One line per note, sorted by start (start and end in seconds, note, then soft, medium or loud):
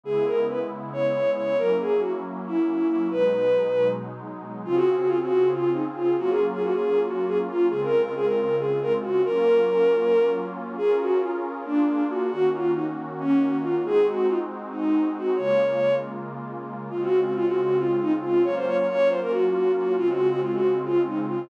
0.03 1.55 C#3 medium
0.03 1.55 G#3 medium
0.03 1.55 B3 medium
0.03 1.55 E4 medium
0.03 0.24 G#4 loud
0.26 0.47 A#4 medium
0.49 0.59 B4 medium
0.93 1.30 C#5 medium
1.36 1.56 C#5 medium
1.58 3.09 F#3 medium
1.58 3.09 A#3 medium
1.58 3.09 C#4 medium
1.58 3.09 E4 medium
1.58 1.77 A#4 loud
1.80 2.01 G#4 medium
2.01 2.11 F#4 medium
2.46 2.87 E4 medium
2.89 3.07 E4 medium
3.11 4.63 B2 medium
3.11 4.63 F#3 medium
3.11 4.63 G#3 medium
3.11 4.63 D#4 medium
3.11 3.88 B4 medium
4.64 6.15 C#3 medium
4.64 6.15 C4 medium
4.64 6.15 F4 medium
4.64 4.75 F4 loud
4.64 6.15 G#4 medium
4.75 4.95 F#4 loud
4.98 5.08 F#4 medium
5.08 5.19 F4 medium
5.20 5.50 F#4 medium
5.51 5.70 F4 medium
5.73 5.84 D#4 medium
5.96 6.17 F4 medium
6.17 7.69 F#3 medium
6.17 7.69 A#3 medium
6.17 7.69 C#4 medium
6.17 7.69 F4 medium
6.17 6.28 F#4 loud
6.28 6.46 G#4 medium
6.52 6.62 G#4 medium
6.63 6.73 F#4 medium
6.72 6.99 G#4 medium
7.06 7.23 F#4 medium
7.28 7.38 G#4 medium
7.48 7.66 F4 medium
7.70 9.22 C#3 medium
7.70 9.22 G#3 medium
7.70 9.22 C4 medium
7.70 9.22 F4 medium
7.70 7.80 G#4 loud
7.82 8.02 A#4 medium
8.02 8.13 A#4 medium
8.15 8.25 G#4 medium
8.25 8.55 A#4 medium
8.59 8.78 G#4 medium
8.82 8.92 A#4 medium
9.01 9.21 F#4 medium
9.24 10.76 F#3 medium
9.24 10.76 A#3 medium
9.24 10.76 C#4 medium
9.24 10.76 F4 medium
9.24 10.32 A#4 loud
10.77 11.65 C#4 medium
10.77 11.64 F4 medium
10.77 10.96 G#4 loud
10.77 11.64 G#4 medium
10.77 11.65 A#4 medium
11.00 11.20 F#4 medium
11.20 11.31 F4 medium
11.64 12.29 A#3 medium
11.64 12.29 D4 medium
11.64 12.03 D4 medium
11.64 12.29 F4 medium
11.64 12.29 G#4 medium
12.10 12.30 F#4 medium
12.30 13.84 D#3 medium
12.30 13.84 A#3 medium
12.30 13.84 C#4 medium
12.30 12.50 F#4 medium
12.30 13.83 F#4 medium
12.52 12.71 F4 medium
12.75 12.85 D#4 medium
13.19 13.56 C#4 medium
13.62 13.83 F4 medium
13.83 15.35 G#3 medium
13.83 15.35 C4 medium
13.83 15.35 D#4 medium
13.83 15.35 F#4 medium
13.83 14.06 G#4 loud
14.06 14.27 F#4 medium
14.28 14.39 F4 medium
14.72 15.09 D#4 medium
15.17 15.38 F#4 medium
15.36 16.90 C#3 medium
15.36 16.90 G#3 medium
15.36 16.90 A#3 medium
15.36 16.90 F4 medium
15.36 15.95 C#5 medium
16.90 18.44 C#3 medium
16.90 18.44 G#3 medium
16.90 18.44 C4 medium
16.90 17.01 F4 medium
16.90 18.44 F4 medium
17.01 17.20 F#4 medium
17.23 17.33 F#4 medium
17.34 17.45 F4 medium
17.46 17.76 F#4 medium
17.79 17.97 F4 medium
18.01 18.12 D#4 medium
18.21 18.42 F4 medium
18.44 19.96 F#3 medium
18.44 19.96 A#3 medium
18.44 19.96 C#4 medium
18.44 19.96 F4 medium
18.44 18.55 C#5 medium
18.55 18.65 C5 medium
18.67 18.76 C#5 medium
18.77 18.87 C#5 medium
18.87 19.08 C#5 loud
19.09 19.20 C5 medium
19.21 19.31 A#4 medium
19.31 19.72 F#4 medium
19.75 19.93 F#4 medium
19.98 21.49 C#3 medium
19.98 21.49 G#3 medium
19.98 21.49 C4 medium
19.98 21.49 F4 medium
19.98 20.08 F4 loud
20.09 20.27 F#4 loud
20.30 20.41 F#4 loud
20.41 20.52 F4 medium
20.52 20.79 F#4 medium
20.84 21.02 F4 medium
21.07 21.17 D#4 medium
21.29 21.48 F4 medium